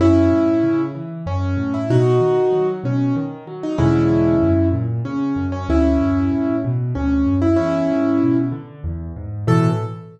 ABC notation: X:1
M:3/4
L:1/16
Q:1/4=95
K:A
V:1 name="Acoustic Grand Piano"
[CE]6 z2 C3 E | [^DF]6 C2 z3 D | [CE]6 z2 C3 C | [CE]6 z2 C3 E |
[CE]6 z6 | A4 z8 |]
V:2 name="Acoustic Grand Piano" clef=bass
F,,2 A,,2 C,2 E,2 F,,2 A,,2 | B,,2 ^D,2 F,2 B,,2 D,2 F,2 | [E,,B,,D,G,]4 F,,2 ^A,,2 C,2 F,,2 | D,,2 F,,2 A,,2 B,,2 D,,2 F,,2 |
E,,2 G,,2 B,,2 D,2 E,,2 G,,2 | [A,,B,,E,]4 z8 |]